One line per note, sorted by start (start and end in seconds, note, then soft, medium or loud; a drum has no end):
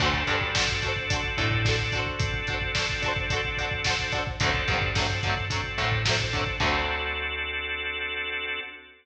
0.00 0.23 D2 loud
0.00 1.98 C4 medium
0.00 1.98 D4 loud
0.00 0.11 D4 loud
0.00 1.98 F#4 loud
0.00 0.11 F#4 loud
0.00 1.98 A4 loud
0.00 kick loud
0.00 crash loud
0.04 0.11 A4 loud
0.04 0.11 C5 loud
0.14 kick medium
0.27 1.21 G2 medium
0.27 0.38 D4 medium
0.27 0.38 F#4 loud
0.27 0.38 A4 medium
0.27 kick medium
0.27 closed hi-hat medium
0.33 0.38 C5 medium
0.41 kick loud
0.55 0.66 D4 medium
0.55 0.66 F#4 medium
0.55 kick loud
0.55 snare loud
0.59 0.66 A4 medium
0.59 0.66 C5 medium
0.68 kick medium
0.82 0.93 D4 medium
0.82 0.93 F#4 medium
0.82 kick medium
0.82 closed hi-hat medium
0.86 0.93 A4 medium
0.86 0.93 C5 medium
0.96 kick medium
1.10 1.21 D4 medium
1.10 1.21 F#4 medium
1.10 1.21 A4 medium
1.10 kick loud
1.10 closed hi-hat loud
1.16 1.21 C5 medium
1.24 kick medium
1.38 2.08 A2 loud
1.38 1.49 D4 medium
1.38 1.49 F#4 medium
1.38 kick loud
1.38 closed hi-hat medium
1.42 1.49 A4 medium
1.42 1.49 C5 medium
1.51 kick loud
1.65 1.76 D4 medium
1.65 1.76 F#4 medium
1.65 1.76 A4 medium
1.65 kick loud
1.65 snare loud
1.71 1.76 C5 medium
1.79 kick medium
1.92 2.32 D4 loud
1.92 2.32 F#4 medium
1.92 kick loud
1.92 closed hi-hat medium
1.97 2.32 A4 loud
1.97 2.32 C5 loud
2.06 kick medium
2.19 4.17 C4 loud
2.19 4.17 D4 loud
2.19 4.17 F#4 medium
2.19 4.17 A4 loud
2.19 kick loud
2.19 closed hi-hat loud
2.34 kick loud
2.47 2.59 D4 medium
2.47 2.59 F#4 medium
2.47 kick loud
2.47 closed hi-hat medium
2.52 2.59 A4 medium
2.52 2.59 C5 medium
2.61 kick medium
2.75 2.86 D4 medium
2.75 2.86 F#4 medium
2.75 kick loud
2.75 snare loud
2.79 2.86 A4 medium
2.79 2.86 C5 medium
2.90 kick loud
3.02 3.13 D4 medium
3.02 3.13 F#4 medium
3.02 3.13 A4 medium
3.02 kick loud
3.02 closed hi-hat medium
3.08 3.13 C5 medium
3.16 kick loud
3.30 3.41 D4 medium
3.30 3.41 F#4 medium
3.30 kick loud
3.30 closed hi-hat loud
3.34 3.41 A4 loud
3.34 3.41 C5 medium
3.45 kick medium
3.57 3.69 D4 medium
3.57 3.69 F#4 medium
3.57 kick medium
3.57 closed hi-hat medium
3.62 3.69 A4 medium
3.62 3.69 C5 medium
3.71 kick loud
3.84 3.96 D4 medium
3.84 3.96 F#4 medium
3.84 kick loud
3.84 snare loud
3.88 3.96 A4 medium
3.88 3.96 C5 medium
3.99 kick medium
4.12 4.24 D4 medium
4.12 4.24 F#4 medium
4.12 kick loud
4.12 closed hi-hat medium
4.16 4.24 A4 medium
4.16 4.24 C5 medium
4.27 kick loud
4.40 4.64 D2 loud
4.40 4.52 D3 loud
4.40 4.52 F#3 loud
4.40 4.90 C4 loud
4.40 4.90 D4 loud
4.40 4.90 F#4 loud
4.40 4.90 A4 loud
4.40 kick loud
4.40 closed hi-hat loud
4.45 4.52 A3 loud
4.45 4.52 C4 loud
4.54 kick loud
4.68 5.61 G2 loud
4.68 4.79 D3 medium
4.68 4.79 F#3 medium
4.68 4.79 A3 medium
4.68 kick loud
4.68 closed hi-hat medium
4.74 4.79 C4 medium
4.81 kick loud
4.95 5.07 D3 medium
4.95 5.07 F#3 medium
4.95 5.45 C4 loud
4.95 5.45 D4 medium
4.95 5.45 F#4 medium
4.95 5.45 A4 medium
4.95 kick loud
4.95 snare loud
5.00 5.07 A3 medium
5.00 5.07 C4 medium
5.10 kick medium
5.23 5.35 D3 medium
5.23 5.35 F#3 medium
5.23 kick loud
5.23 closed hi-hat medium
5.28 5.35 A3 medium
5.28 5.35 C4 medium
5.37 kick loud
5.50 5.61 D3 medium
5.50 5.61 F#3 medium
5.50 5.61 A3 medium
5.50 6.01 C4 loud
5.50 6.01 D4 medium
5.50 6.01 F#4 medium
5.50 6.01 A4 medium
5.50 kick loud
5.50 closed hi-hat loud
5.56 5.61 C4 medium
5.64 kick medium
5.78 6.48 A2 loud
5.78 5.89 D3 medium
5.78 5.89 F#3 medium
5.78 kick medium
5.78 closed hi-hat medium
5.82 5.89 A3 medium
5.82 5.89 C4 medium
5.92 kick loud
6.05 6.16 D3 medium
6.05 6.16 F#3 medium
6.05 6.16 A3 medium
6.05 6.57 C4 medium
6.05 6.57 D4 medium
6.05 6.57 F#4 medium
6.05 6.57 A4 loud
6.05 kick loud
6.05 snare loud
6.11 6.16 C4 medium
6.20 kick medium
6.33 6.44 D3 medium
6.33 6.44 F#3 medium
6.33 6.44 A3 medium
6.33 kick loud
6.33 closed hi-hat medium
6.39 6.44 C4 medium
6.47 kick loud
6.60 8.60 D2 loud
6.60 8.59 D3 loud
6.60 8.59 F#3 loud
6.60 8.60 C4 loud
6.60 8.60 D4 medium
6.60 8.60 F#4 loud
6.60 8.60 A4 loud
6.60 kick loud
6.60 crash loud
6.64 8.59 A3 medium
6.64 8.59 C4 loud